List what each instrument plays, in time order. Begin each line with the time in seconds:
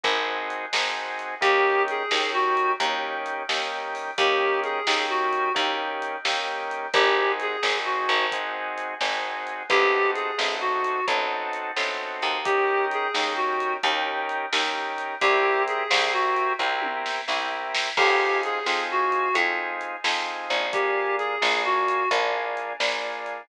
0.04 electric bass (finger) G#1, drawbar organ C4 D#4 F#4 G#4, kick, closed hi-hat
0.50 closed hi-hat
0.73 electric bass (finger) G#1, drawbar organ C4 D#4 F#4 G#4, snare
1.19 closed hi-hat
1.41 electric bass (finger) D#2, drawbar organ A#3 C#4 D#4 G4, clarinet G4, kick, closed hi-hat
1.88 clarinet G#4, closed hi-hat
2.11 electric bass (finger) D#2, drawbar organ A#3 C#4 D#4 G4, snare
2.33 clarinet F#4
2.57 closed hi-hat
2.80 electric bass (finger) D#2, drawbar organ A#3 C#4 D#4 G4, kick, closed hi-hat
3.26 closed hi-hat
3.49 electric bass (finger) D#2, drawbar organ A#3 C#4 D#4 G4, snare
3.95 open hi-hat
4.18 electric bass (finger) D#2, drawbar organ A#3 C#4 D#4 G4, clarinet G4, kick, closed hi-hat
4.64 clarinet G#4, closed hi-hat
4.87 electric bass (finger) D#2, drawbar organ A#3 C#4 D#4 G4, snare
5.10 clarinet F#4
5.33 closed hi-hat
5.54 electric bass (finger) D#2, drawbar organ A#3 C#4 D#4 G4, kick, closed hi-hat
6.02 closed hi-hat
6.25 electric bass (finger) D#2, drawbar organ A#3 C#4 D#4 G4, snare
6.71 closed hi-hat
6.93 electric bass (finger) G#1, drawbar organ C4 D#4 F#4 G#4, clarinet G4, kick, closed hi-hat
7.40 clarinet G#4, closed hi-hat
7.63 electric bass (finger) G#1, drawbar organ C4 D#4 F#4 G#4, snare
7.85 clarinet F#4
8.09 electric bass (finger) G#1, closed hi-hat
8.32 drawbar organ C4 D#4 F#4 G#4, kick, closed hi-hat
8.78 closed hi-hat
9.01 electric bass (finger) G#1, drawbar organ C4 D#4 F#4 G#4, snare
9.47 closed hi-hat
9.69 electric bass (finger) A1, drawbar organ C4 D#4 F#4 A4, clarinet G4, kick, closed hi-hat
10.15 clarinet G#4, closed hi-hat
10.38 electric bass (finger) A1, drawbar organ C4 D#4 F#4 A4, snare
10.61 clarinet F#4
10.84 closed hi-hat
11.07 electric bass (finger) A1, drawbar organ C4 D#4 F#4 A4, kick, closed hi-hat
11.53 closed hi-hat
11.76 electric bass (finger) A1, drawbar organ C4 D#4 F#4 A4, snare
12.22 electric bass (finger) D#2, closed hi-hat
12.45 drawbar organ C#4 D#4 G4 A#4, clarinet G4, kick, closed hi-hat
12.91 clarinet G#4, closed hi-hat
13.14 electric bass (finger) D#2, drawbar organ C#4 D#4 G4 A#4, snare
13.36 clarinet F#4
13.60 closed hi-hat
13.83 electric bass (finger) D#2, drawbar organ C#4 D#4 G4 A#4, kick, closed hi-hat
14.29 closed hi-hat
14.53 electric bass (finger) D#2, drawbar organ C#4 D#4 G4 A#4, snare
14.98 closed hi-hat
15.21 electric bass (finger) C2, drawbar organ C4 E4 G4 A#4, clarinet G4, kick, closed hi-hat
15.68 clarinet G#4, closed hi-hat
15.91 electric bass (finger) C2, drawbar organ C4 E4 G4 A#4, snare
16.13 clarinet F#4
16.36 closed hi-hat
16.59 electric bass (finger) C2, drawbar organ C4 E4 G4 A#4, kick
16.82 high tom
17.06 snare
17.27 electric bass (finger) C2, drawbar organ C4 E4 G4 A#4, snare
17.75 snare
17.97 electric bass (finger) F2, drawbar organ C4 D#4 F4 G#4, clarinet G4, kick, crash
18.43 clarinet G#4, closed hi-hat
18.66 electric bass (finger) F2, drawbar organ C4 D#4 F4 G#4, snare
18.91 clarinet F#4
19.12 closed hi-hat
19.34 electric bass (finger) F2, drawbar organ C4 D#4 F4 G#4, kick, closed hi-hat
19.81 closed hi-hat
20.04 electric bass (finger) F2, drawbar organ C4 D#4 F4 G#4, snare
20.50 electric bass (finger) A#1, closed hi-hat
20.73 drawbar organ A#3 D4 F4 G#4, clarinet G4, kick, closed hi-hat
21.18 clarinet G#4, closed hi-hat
21.41 electric bass (finger) A#1, drawbar organ A#3 D4 F4 G#4, snare
21.65 clarinet F#4
21.88 closed hi-hat
22.11 electric bass (finger) A#1, drawbar organ A#3 D4 F4 G#4, kick, closed hi-hat
22.57 closed hi-hat
22.80 electric bass (finger) A#1, drawbar organ A#3 D4 F4 G#4, snare
23.26 closed hi-hat